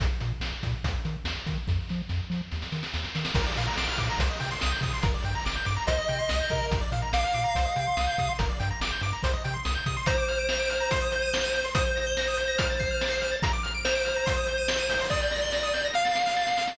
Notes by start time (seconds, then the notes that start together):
0.00 A#1, kick, closed hi-hat
0.20 A#2, closed hi-hat
0.40 A#1, snare
0.63 A#2, kick, closed hi-hat
0.84 D#2, kick, closed hi-hat
1.05 D#3, closed hi-hat
1.24 D#2, snare
1.46 D#3, kick, closed hi-hat
1.67 F2, kick, snare
1.89 F3, snare
2.09 F2, snare
2.30 F3, snare
2.51 D#2, snare
2.62 snare
2.72 D#3, snare
2.83 snare
2.94 D#2, snare
3.04 snare
3.15 D#3, snare
3.25 snare
3.35 A#1 A#4, kick, crash
3.46 D5
3.56 A#2 F5, closed hi-hat
3.67 A#5
3.76 A#1 D6, snare
3.89 F6
3.98 A#2 D6, kick, closed hi-hat
4.10 A#5
4.19 C2 C5, kick, closed hi-hat
4.30 D#5
4.40 C3 G5, closed hi-hat
4.51 C6
4.61 C2 D#6, snare
4.72 G6
4.81 C3 D#6, kick, closed hi-hat
4.93 C6
5.03 G1 A#4, kick, closed hi-hat
5.14 D5
5.24 G2 G5, closed hi-hat
5.35 A#5
5.45 G1 D6, snare
5.56 G6
5.65 G2 D6, closed hi-hat
5.76 A#5
5.87 C2 C5 D#5, kick, closed hi-hat
5.98 D#5
6.08 C3 G5, closed hi-hat
6.19 C6
6.29 C2 D#6, snare
6.40 G6
6.50 C3 A#4, kick, closed hi-hat
6.71 A#1, kick, closed hi-hat
6.81 D5
6.92 A#2 F5, closed hi-hat
7.02 A#5
7.13 A#1 F5 D6, snare
7.24 F6
7.34 A#2 D6, closed hi-hat
7.44 A#5
7.55 C2 C5, kick, closed hi-hat
7.65 D#5
7.76 C3 G5, closed hi-hat
7.87 C6
7.97 C2 D#6, snare
8.07 G6
8.18 C3 D#6, kick, closed hi-hat
8.28 C6
8.39 G1 A#4, kick, closed hi-hat
8.49 D5
8.60 G2 G5, closed hi-hat
8.71 A#5
8.81 G1 D6, snare
8.91 G6
9.01 G2 D6, closed hi-hat
9.13 A#5
9.23 C2 C5, kick, closed hi-hat
9.33 D#5
9.44 C3 G5, closed hi-hat
9.54 C6
9.65 C2 D#6, snare
9.75 G6
9.86 C3 D#6, kick, closed hi-hat
9.97 C6
10.06 C5 A#5, kick, closed hi-hat
10.18 D6
10.28 F6, closed hi-hat
10.39 D7
10.49 F7, snare
10.59 D7
10.70 F6, closed hi-hat
10.80 A#5
10.91 C6, kick, closed hi-hat
11.02 D#6
11.12 G6, closed hi-hat
11.22 D#7
11.33 G7, snare
11.44 D#7
11.54 G6, closed hi-hat
11.64 C6
11.75 C5 D#6, kick, closed hi-hat
11.86 G6
11.96 A#6, closed hi-hat
12.07 G7
12.17 A#6, snare
12.28 D#6
12.37 G6, closed hi-hat
12.48 A#6
12.58 F6, kick, closed hi-hat
12.70 A6
12.80 C7, kick, closed hi-hat
12.91 F6
13.01 A6, snare
13.11 C7
13.21 F6, closed hi-hat
13.31 A6
13.42 A#5, kick, closed hi-hat
13.53 D6
13.63 F6, closed hi-hat
13.74 D7
13.85 C5 F7, snare
13.95 D7
14.05 F6, closed hi-hat
14.16 A#5
14.26 C6, kick, closed hi-hat
14.37 D#6
14.46 G6, closed hi-hat
14.58 D#7
14.68 G7, snare
14.79 D#7
14.89 G6, open hi-hat
15.00 C6
15.10 D5 D#6, kick, snare
15.22 G6
15.31 A#6, snare
15.42 G7
15.52 A#6, snare
15.63 D#6
15.74 G6, snare
15.85 A#6
15.94 F5 F6, snare
16.05 A6, snare
16.15 C7, snare
16.26 F6, snare
16.37 A6, snare
16.47 C7, snare
16.57 F6, snare
16.68 A6, snare